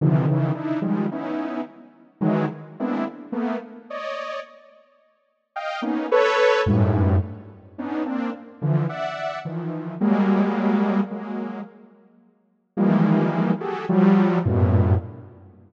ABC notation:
X:1
M:7/8
L:1/16
Q:1/4=54
K:none
V:1 name="Lead 2 (sawtooth)"
[C,D,^D,E,F,] [^C,D,E,] [=D^DE] [D,F,G,^G,] [B,^CDE]2 z2 [D,E,^F,G,] z [G,^A,B,=C=DE] z [=A,^A,B,] z | [^cd^d]2 z4 [dfg] [^A,B,^C^D] [=ABc]2 [^F,,G,,^G,,A,,]2 z2 | [B,^CD^D] [^A,=C=D] z [D,E,F,] [de^f]2 [^D,E,=F,]2 [^F,G,^G,A,]4 [F,G,A,]2 | z4 [^D,E,F,G,^G,^A,]3 [^F=G^G=A] [=F,^F,=G,]2 [^F,,G,,A,,^A,,B,,]2 z2 |]